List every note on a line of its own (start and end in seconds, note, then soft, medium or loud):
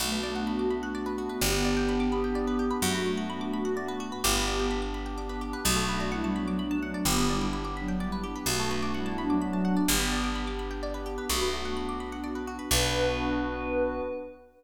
0.00 1.29 B1 medium
0.00 1.30 A3 medium
0.00 1.39 B3 medium
0.00 1.39 D4 medium
0.00 1.30 F#4 medium
0.00 1.39 F#4 medium
0.00 0.11 F#4 loud
0.12 0.23 B4 medium
0.23 0.34 D5 medium
0.35 0.46 F#5 medium
0.47 0.58 B5 medium
0.59 0.70 D6 medium
0.70 0.81 B5 medium
0.83 0.93 F#5 medium
0.95 1.05 D5 medium
1.06 1.16 B4 medium
1.18 1.28 F#4 medium
1.29 1.40 B4 medium
1.40 2.71 G1 medium
1.40 2.80 B3 medium
1.40 2.69 B3 medium
1.40 2.80 D4 medium
1.40 2.80 G4 medium
1.40 2.69 G4 medium
1.40 1.52 G4 loud
1.53 1.63 B4 medium
1.65 1.75 D5 medium
1.76 1.87 G5 medium
1.88 1.99 B5 medium
2.00 2.10 D6 medium
2.12 2.22 B5 medium
2.24 2.34 G5 medium
2.35 2.46 D5 medium
2.47 2.58 B4 medium
2.59 2.70 G4 medium
2.70 2.81 B4 medium
2.81 4.12 F#2 medium
2.81 4.11 A3 medium
2.81 4.21 B3 medium
2.81 4.21 D4 medium
2.81 4.21 F#4 medium
2.81 2.93 F#4 loud
2.81 4.11 F#4 medium
2.94 3.05 B4 medium
3.06 3.17 D5 medium
3.17 3.28 F#5 medium
3.30 3.40 B5 medium
3.41 3.51 D6 medium
3.53 3.64 B5 medium
3.65 3.75 F#5 medium
3.76 3.87 D5 medium
3.88 3.99 B4 medium
4.00 4.10 F#4 loud
4.12 4.22 B4 medium
4.24 5.54 G1 loud
4.24 4.66 B3 medium
4.24 5.64 B3 medium
4.24 5.64 D4 medium
4.24 4.66 G4 medium
4.24 4.34 G4 loud
4.24 5.65 G4 medium
4.35 4.46 B4 medium
4.47 4.58 D5 medium
4.59 4.70 G5 medium
4.70 4.81 B5 medium
4.82 4.93 D6 medium
4.94 5.05 B5 medium
5.06 5.16 G5 medium
5.18 5.28 D5 medium
5.29 5.40 B4 medium
5.41 5.52 G4 medium
5.53 5.64 B4 medium
5.65 6.95 B1 loud
5.65 7.04 A3 medium
5.65 6.05 A3 medium
5.65 7.04 B3 medium
5.65 7.04 D4 medium
5.65 5.75 F#4 loud
5.65 7.04 F#4 medium
5.65 6.05 F#4 medium
5.76 5.87 A4 loud
5.88 5.99 B4 medium
6.00 6.11 D5 medium
6.11 6.33 G3 medium
6.11 6.33 E4 medium
6.11 6.22 F#5 medium
6.24 6.34 A5 medium
6.35 6.57 F#3 medium
6.35 6.57 D4 medium
6.35 6.46 B5 medium
6.47 6.58 D6 medium
6.59 7.02 F#3 medium
6.59 7.02 D4 medium
6.59 6.69 B5 medium
6.71 6.81 A5 loud
6.82 6.93 F#5 medium
6.94 7.05 D5 medium
7.05 8.35 G1 medium
7.05 8.46 B3 medium
7.05 7.27 B3 medium
7.05 8.46 D4 medium
7.05 8.46 G4 medium
7.05 7.16 G4 loud
7.05 7.27 G4 loud
7.18 7.28 B4 medium
7.29 7.49 G3 medium
7.29 7.49 E4 medium
7.29 7.40 D5 medium
7.41 7.52 G5 medium
7.53 7.64 B5 loud
7.65 7.75 D6 medium
7.76 7.96 F#3 medium
7.76 7.96 D4 medium
7.76 7.87 B5 medium
7.88 7.99 G5 medium
8.00 8.11 G3 medium
8.00 8.11 E4 medium
8.00 8.11 D5 medium
8.12 8.23 B4 medium
8.23 8.34 G4 medium
8.35 8.46 B4 medium
8.46 9.76 B1 medium
8.46 9.86 A3 medium
8.46 8.93 A3 medium
8.46 9.86 B3 medium
8.46 9.86 D4 medium
8.46 9.86 F#4 medium
8.46 8.93 F#4 medium
8.46 8.58 F#4 loud
8.59 8.70 A4 medium
8.71 8.81 B4 medium
8.82 8.93 D5 medium
8.94 9.16 G3 medium
8.94 9.16 E4 medium
8.94 9.05 F#5 medium
9.06 9.16 A5 medium
9.18 9.38 F#3 medium
9.18 9.38 D4 medium
9.18 9.29 B5 medium
9.30 9.40 D6 medium
9.41 9.81 F#3 medium
9.41 9.81 D4 medium
9.41 9.52 B5 medium
9.53 9.64 A5 medium
9.65 9.75 F#5 medium
9.76 9.87 D5 medium
9.88 11.18 G1 loud
9.88 11.27 B3 medium
9.88 10.28 B3 medium
9.88 11.27 D4 medium
9.88 11.27 G4 medium
9.88 10.28 G4 medium
9.88 9.99 G4 loud
10.00 10.10 B4 medium
10.12 10.22 D5 medium
10.23 10.34 G5 medium
10.35 10.46 B5 medium
10.47 10.58 D6 medium
10.59 10.70 B5 medium
10.70 10.81 G5 medium
10.83 10.93 D5 medium
10.94 11.05 B4 medium
11.06 11.16 G4 medium
11.18 11.28 B4 medium
11.29 12.59 B1 medium
11.29 11.75 A3 medium
11.29 12.70 B3 medium
11.29 12.70 D4 medium
11.29 11.40 F#4 loud
11.29 11.75 F#4 medium
11.29 12.70 F#4 medium
11.41 11.52 B4 medium
11.53 11.63 D5 medium
11.65 11.76 F#5 medium
11.76 11.87 B5 medium
11.89 11.99 D6 medium
12.00 12.11 B5 medium
12.12 12.23 F#5 medium
12.24 12.34 D5 medium
12.35 12.46 B4 medium
12.47 12.58 F#4 medium
12.59 12.69 B4 medium
12.71 14.01 B1 loud
12.71 14.02 B3 loud
12.71 14.02 D4 loud
12.71 14.01 F#4 loud
12.71 14.02 F#4 loud
12.71 14.01 B4 loud
12.71 14.01 B4 medium
12.71 14.01 D5 medium